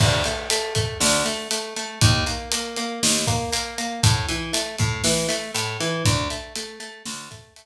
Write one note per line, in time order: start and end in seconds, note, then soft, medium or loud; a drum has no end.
0.00 0.23 D2 medium
0.00 kick loud
0.00 crash loud
0.24 0.48 A3 medium
0.24 closed hi-hat medium
0.50 0.74 A3 medium
0.50 closed hi-hat loud
0.75 0.98 A3 medium
0.75 kick medium
0.75 closed hi-hat medium
1.00 1.23 D2 medium
1.00 snare loud
1.25 1.48 A3 medium
1.25 closed hi-hat medium
1.51 1.74 A3 medium
1.51 closed hi-hat medium
1.76 1.99 A3 medium
1.76 closed hi-hat medium
2.01 2.24 D#2 loud
2.01 kick loud
2.01 closed hi-hat loud
2.26 2.49 A#3 medium
2.26 closed hi-hat medium
2.52 2.75 A#3 medium
2.52 closed hi-hat loud
2.76 3.00 A#3 medium
2.76 closed hi-hat medium
3.03 3.26 D#2 medium
3.03 snare loud
3.27 3.50 A#3 medium
3.27 kick medium
3.27 closed hi-hat medium
3.52 3.75 A#3 medium
3.52 closed hi-hat medium
3.78 4.01 A#3 medium
3.78 closed hi-hat medium
4.03 4.26 A2 medium
4.03 kick loud
4.03 closed hi-hat loud
4.28 4.51 E3 medium
4.28 closed hi-hat medium
4.53 4.76 A3 medium
4.53 closed hi-hat loud
4.78 5.02 A2 medium
4.78 kick medium
4.78 closed hi-hat medium
5.04 5.27 E3 medium
5.04 snare loud
5.29 5.51 A3 medium
5.29 closed hi-hat medium
5.54 5.77 A2 medium
5.54 closed hi-hat medium
5.80 6.03 E3 medium
5.80 closed hi-hat medium
6.05 6.28 D2 medium
6.05 kick loud
6.05 closed hi-hat medium
6.30 6.53 A3 medium
6.30 closed hi-hat medium
6.55 6.79 A3 medium
6.55 closed hi-hat medium
6.80 7.03 A3 medium
6.80 closed hi-hat medium
7.06 7.29 D2 medium
7.06 snare loud
7.31 7.54 A3 medium
7.31 kick medium
7.31 closed hi-hat medium
7.56 7.66 A3 medium
7.56 closed hi-hat medium